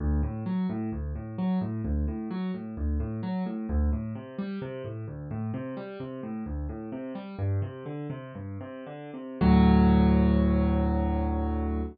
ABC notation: X:1
M:4/4
L:1/8
Q:1/4=130
K:D
V:1 name="Acoustic Grand Piano" clef=bass
D,, A,, F, A,, D,, A,, F, A,, | D,, A,, F, A,, D,, A,, F, A,, | D,, A,, =C, G, C, A,, D,, A,, | =C, G, C, A,, D,, A,, C, G, |
"^rit." G,, =C, D, C, G,, C, D, C, | [D,,A,,F,]8 |]